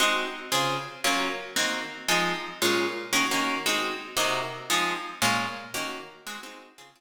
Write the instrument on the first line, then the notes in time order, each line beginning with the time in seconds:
acoustic guitar (steel)
0.00 G#3 C4 D#4 F#4
0.52 C#3 C4 F4 G#4
1.04 F#3 A#3 C#4 F4
1.56 D#3 A#3 C4 F#4
2.08 F3 G#3 C4 D#4
2.62 A#2 G#3 C#4 F4
3.13 D#3 A#3 C#4 F#4
3.31 D#3 A#3 C#4 F#4
3.66 G#3 C4 D#4 F#4
4.17 C3 A#3 D#4 F#4
4.70 F3 G#3 C4 D#4
5.22 A#2 G#3 C#4 F4
5.74 D#3 A#3 C#4 F#4
6.27 G#3 C4 D#4 F#4
6.43 G#3 C4 D#4 F#4
6.78 C#3 C4 F4 G#4
6.96 C#3 C4 F4 G#4